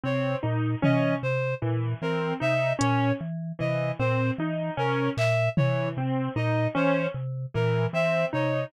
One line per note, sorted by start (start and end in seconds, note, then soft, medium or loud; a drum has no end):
0.04 0.35 C3 medium
0.04 0.35 C4 medium
0.04 0.36 C#5 medium
0.43 0.75 A#2 medium
0.43 0.74 D#4 medium
0.82 1.15 E3 medium
0.82 1.14 C#4 medium
0.82 1.15 D#5 medium
0.82 floor tom medium
1.23 1.55 C3 medium
1.23 1.55 C5 medium
1.62 1.94 A#2 medium
1.62 1.93 E3 medium
2.02 2.33 E3 medium
2.02 2.34 C4 medium
2.02 2.34 A#4 medium
2.40 2.73 C3 medium
2.40 2.72 D#4 medium
2.40 2.73 E5 medium
2.79 3.12 A#2 medium
2.79 3.10 C#4 medium
2.79 3.13 C#5 medium
2.79 closed hi-hat medium
3.21 3.52 E3 medium
3.59 3.92 C3 medium
3.59 3.90 E3 medium
3.59 3.91 D#5 medium
3.99 4.31 A#2 medium
3.99 4.31 C4 medium
3.99 4.31 C5 medium
4.38 4.70 E3 medium
4.38 4.71 D#4 medium
4.77 5.09 C3 medium
4.77 5.09 C#4 medium
4.77 5.10 A#4 medium
5.17 5.49 A#2 medium
5.17 5.49 E5 medium
5.17 clap medium
5.57 5.89 E3 medium
5.57 5.89 C#5 medium
5.57 floor tom medium
5.97 6.29 C3 medium
5.97 6.29 C4 medium
6.36 6.68 A#2 medium
6.36 6.68 D#4 medium
6.36 6.68 D#5 medium
6.75 7.07 E3 medium
6.75 7.06 C#4 medium
6.75 7.07 C5 medium
7.14 7.46 C3 medium
7.54 7.87 A#2 medium
7.54 7.86 E3 medium
7.54 7.86 A#4 medium
7.93 8.25 E3 medium
7.93 8.25 C4 medium
7.93 8.26 E5 medium
8.33 8.65 C3 medium
8.33 8.64 D#4 medium
8.33 8.65 C#5 medium